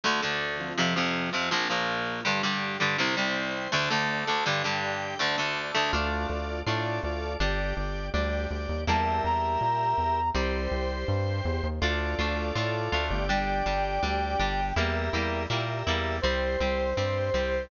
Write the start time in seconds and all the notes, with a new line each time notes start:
0.04 D2 D3 A3 D4 A4
0.22 D2 D3 A3
0.59 F3 C4 F4
0.78 F2 C3 F3
0.96 F2 C3 F3
1.33 F2 C3 F3
1.51 A#1 A#2 F3 A#3 F4
1.70 A#1 A#2 F3
2.25 G2 D3 G3 D4 G4
2.43 G2 D3 G3
2.80 G2 D3 G3
2.98 C2 C3 G3 C4 C5 G5
3.17 C2 C3 G3
3.72 D2 D3 A3 D4 D5 A5
3.90 D2 D3 A3
4.27 D2 D3 A3
4.46 G2 D3 G3 G4 D5 G5
4.64 G2 D3 G3
5.19 D2 D3 A3 D4 D5 A5
5.38 D2 D3 A3
5.75 D2 D3 A3
5.93 D2 A3 D4 F4 A4 D5
6.29 D2 F4 A4 D5
6.66 A2 A3 D4 F4 A4 D5
7.03 D2 F4 A4 D5
7.40 G1 G3 D4 G4 D5
7.77 G1 G4 D5
8.14 D2 G3 D4 G4 D5
8.51 D2 G4 D5
8.69 D#2
8.87 E2 G3 A#3 E4 G4 A#4 E5 A5
9.24 E2 A#5
9.61 A#2
9.98 E2
10.35 C2 G3 C4 G4 C5
10.71 C2
11.08 G2
11.45 E2
11.63 D#2
11.81 D2 A3 D4 F4 A4 D5
12.19 D2 A3 D4 F4
12.55 A2 A3 D4 F4
12.92 D2 A3 D4 F4
13.10 G1 G4 D5
13.28 G3 D4 G5
13.66 G1 G3 D4
14.03 D2 G3 D4
14.39 G1 G3 D4
14.76 E2 G3 A#3 E4 G4 A#4 E5
15.13 E2 G3 A#3 E4
15.50 A#2 G3 A#3 E4 G4 A#4 E5
15.87 E2 G3 A#3 E4
16.22 C2 G3 C4 G4 C5
16.60 C2 G3 C4
16.97 G2 G3 C4 G4 C5
17.34 C2 G3 C4